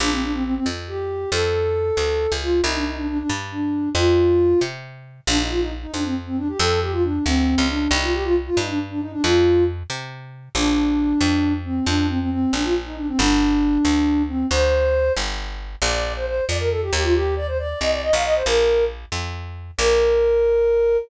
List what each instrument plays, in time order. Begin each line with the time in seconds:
0.00 electric bass (finger) A#1, flute D4
0.11 flute C4
0.22 flute D4
0.33 flute C4
0.44 flute C4
0.55 flute C4
0.66 electric bass (finger) F2
0.88 flute G4
1.32 electric bass (finger) F2, flute A4
1.97 electric bass (finger) D2
2.32 electric bass (finger) C#2
2.42 flute F4
2.64 electric bass (finger) C2, flute D#4
2.75 flute D4
2.86 flute D#4
2.97 flute D4
3.08 flute D4
3.19 flute D4
3.29 electric bass (finger) G2
3.52 flute D4
3.95 electric bass (finger) F2, flute F4
4.61 electric bass (finger) C3
5.27 electric bass (finger) A#1, flute D4
5.39 flute D#4
5.50 flute F4
5.60 flute D#4
5.82 flute D#4
5.93 electric bass (finger) F2, flute D4
6.04 flute C4
6.26 flute C4
6.37 flute D4
6.48 flute G4
6.59 electric bass (finger) F2, flute A4
6.82 flute G4
6.92 flute F4
7.03 flute D4
7.25 electric bass (finger) D2, flute C4
7.58 electric bass (finger) C#2
7.69 flute D4
7.91 electric bass (finger) C2, flute D#4
8.02 flute F4
8.14 flute G4
8.24 flute F4
8.46 flute F4
8.57 electric bass (finger) G2, flute D#4
8.68 flute D4
8.90 flute D4
9.01 flute D#4
9.12 flute D4
9.23 electric bass (finger) F2, flute F4
9.90 electric bass (finger) C3
10.55 electric bass (finger) A#1, flute D4
11.21 electric bass (finger) F2
11.65 flute C4
11.86 electric bass (finger) F2, flute D4
12.09 flute C4
12.20 flute C4
12.31 flute C4
12.53 electric bass (finger) A#1, flute D4
12.64 flute F4
12.86 flute D#4
12.97 flute D4
13.08 flute C4
13.19 electric bass (finger) G1, flute D4
13.85 electric bass (finger) D2
14.28 flute C4
14.51 electric bass (finger) D2, flute C5
15.17 electric bass (finger) G1
15.82 electric bass (finger) A#1, flute D5
16.16 flute C5
16.26 flute C5
16.48 electric bass (finger) F2, flute D5
16.59 flute A#4
16.70 flute A4
16.82 flute G4
16.92 electric bass (finger) D#2, flute G4
17.03 flute F4
17.14 flute G4
17.36 flute D5
17.47 flute C5
17.59 flute D5
17.80 electric bass (finger) C2, flute D#5
17.91 flute D5
18.02 flute D#5
18.13 electric bass (finger) B1, flute F5
18.24 flute D#5
18.35 flute C5
18.46 electric bass (finger) A#1, flute A#4
19.12 electric bass (finger) F2
19.78 electric bass (finger) A#1, flute A#4